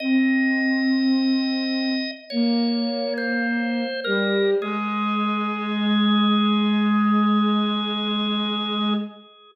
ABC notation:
X:1
M:4/4
L:1/16
Q:1/4=52
K:Ab
V:1 name="Drawbar Organ"
e8 d3 c3 B2 | A16 |]
V:2 name="Choir Aahs"
C8 B,6 G,2 | A,16 |]